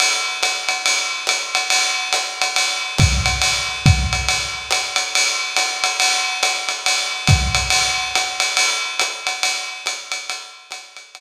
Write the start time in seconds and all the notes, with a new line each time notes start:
0.00 ride
0.43 hi-hat pedal, ride
0.69 ride
0.86 ride
1.27 hi-hat pedal, ride
1.55 ride
1.70 ride
2.13 hi-hat pedal, ride
2.42 ride
2.56 ride
2.98 kick, hi-hat pedal, ride
3.26 ride
3.42 ride
3.86 kick, ride
4.13 ride
4.28 ride
4.71 hi-hat pedal, ride
4.96 ride
5.15 ride
5.57 hi-hat pedal, ride
5.84 ride
6.00 ride
6.43 hi-hat pedal, ride
6.69 ride
6.86 ride
7.27 kick, hi-hat pedal, ride
7.55 ride
7.70 ride
8.15 hi-hat pedal, ride
8.40 ride
8.57 ride
8.99 hi-hat pedal, ride
9.27 ride
9.43 ride
9.86 hi-hat pedal, ride
10.12 ride
10.30 ride
10.71 hi-hat pedal, ride
10.97 ride
11.15 ride